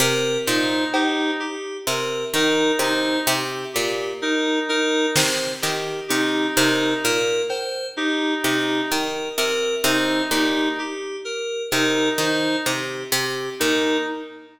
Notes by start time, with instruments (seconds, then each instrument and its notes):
0.00 harpsichord C3, electric piano 2 A#4
0.46 harpsichord A#2, clarinet D#4, electric piano 2 C5
0.93 clarinet D#4, electric piano 2 G4, cowbell
1.39 electric piano 2 G4
1.87 harpsichord C3, electric piano 2 A#4
2.34 harpsichord D#3, clarinet D#4, electric piano 2 A#4, cowbell
2.79 harpsichord C3, clarinet D#4, electric piano 2 C5
3.27 harpsichord C3, electric piano 2 G4
3.73 harpsichord A#2, electric piano 2 G4
4.22 clarinet D#4, electric piano 2 A#4
4.69 clarinet D#4, electric piano 2 A#4
5.15 harpsichord C3, electric piano 2 C5, snare
5.62 harpsichord D#3, electric piano 2 G4, clap
6.08 harpsichord C3, clarinet D#4, electric piano 2 G4
6.56 harpsichord C3, clarinet D#4, electric piano 2 A#4
7.04 harpsichord A#2, electric piano 2 A#4
7.49 electric piano 2 C5, cowbell
7.97 clarinet D#4, electric piano 2 G4
8.43 harpsichord C3, clarinet D#4, electric piano 2 G4
8.90 harpsichord D#3, electric piano 2 A#4
9.38 harpsichord C3, electric piano 2 A#4
9.84 harpsichord C3, clarinet D#4, electric piano 2 C5
10.31 harpsichord A#2, clarinet D#4, electric piano 2 G4
10.79 electric piano 2 G4
11.25 electric piano 2 A#4
11.71 harpsichord C3, clarinet D#4, electric piano 2 A#4
12.18 harpsichord D#3, clarinet D#4, electric piano 2 C5
12.66 harpsichord C3, electric piano 2 G4
13.12 harpsichord C3, electric piano 2 G4
13.60 harpsichord A#2, clarinet D#4, electric piano 2 A#4